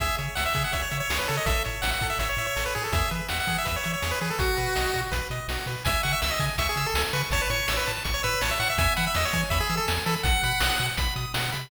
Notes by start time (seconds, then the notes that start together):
0.00 C#2 G#4 E5, kick, closed hi-hat
0.18 C#3 C#5, closed hi-hat
0.35 C#2 E5 F#5, snare
0.46 E5
0.55 C#3 G#4, kick, closed hi-hat
0.64 F#5
0.73 C#2 C#5 E5, kick, closed hi-hat
0.82 C#5
0.91 C#3 E5, closed hi-hat
1.00 C#5
1.09 C#2 G#4, snare
1.19 B4
1.27 C#3 A4 C#5, closed hi-hat
1.37 D#5
1.46 A1 A4 E5, kick, closed hi-hat
1.64 A2 C#5, closed hi-hat
1.82 A1 E5 F#5, snare
1.91 F#5
2.01 A2 A4, kick, closed hi-hat
2.10 E5
2.19 A1 C#5 E5, kick, closed hi-hat
2.29 C#5
2.37 A2 E5, closed hi-hat
2.47 C#5
2.56 A1 A4, snare
2.66 B4
2.74 A2 G#4 C#5, closed hi-hat
2.84 A4
2.92 E2 G#4 E5, kick, closed hi-hat
3.11 E3 B4, closed hi-hat
3.29 E2 E5 F#5, snare
3.40 F#5
3.47 E3 G#4, kick, closed hi-hat
3.58 E5
3.65 E2 B4 E5, kick, closed hi-hat
3.76 C#5
3.84 E3 E5, closed hi-hat
3.93 C#5
4.02 E2 G#4, snare
4.11 B4
4.21 E3 G#4 B4, closed hi-hat
4.30 A4
4.39 B1 F#4, kick, closed hi-hat
4.57 B2 B4, closed hi-hat
4.75 B1 D#5, snare
4.93 B2 F#4, kick, closed hi-hat
5.12 B1 B4, kick, closed hi-hat
5.30 B2 D#5, closed hi-hat
5.48 B1 F#4, snare
5.66 B2 B4, closed hi-hat
5.85 C#2 E5 G#5, kick, closed hi-hat
6.03 C#3 F#5 C#6, closed hi-hat
6.13 E5
6.21 C#2 E5 E6, snare
6.30 D#5
6.39 C#3 G#5, kick, closed hi-hat
6.58 C#2 E5 C#6, kick, closed hi-hat
6.69 G#4
6.76 C#3 E6, closed hi-hat
6.86 A4
6.94 C#2 G#5, snare
7.13 C#3 B4 C#6, closed hi-hat
7.31 A1 C#5 A5, kick, closed hi-hat
7.42 B4
7.50 A2 C#5 C#6, closed hi-hat
7.68 A1 E6, snare
7.77 B4
7.87 A2 A5, closed hi-hat
8.04 A1 C#6, kick, closed hi-hat
8.14 C#5
8.23 A2 B4 E6, closed hi-hat
8.41 A1 C#5 A5, snare
8.51 E5
8.60 A2 F#5 C#6, closed hi-hat
8.70 E5
8.78 E2 E5 G#5, kick, closed hi-hat
8.96 E3 F#5 B5, closed hi-hat
9.07 E5
9.14 E2 D#5 E6, snare
9.25 C#5
9.33 E3 G#5, kick, closed hi-hat
9.50 E2 E5 B5, kick, closed hi-hat
9.60 G#4
9.70 E3 E6, closed hi-hat
9.77 A4
9.88 E2 G#5, snare
10.06 E3 A4 B5, closed hi-hat
10.23 B1 F#5, kick, closed hi-hat
10.43 B2 B5, closed hi-hat
10.60 B1 D#6, snare
10.79 B2 F#5, closed hi-hat
10.97 B1 B5, kick, closed hi-hat
11.16 B2 D#6, closed hi-hat
11.34 B2 F#5, snare
11.52 C3 B5, closed hi-hat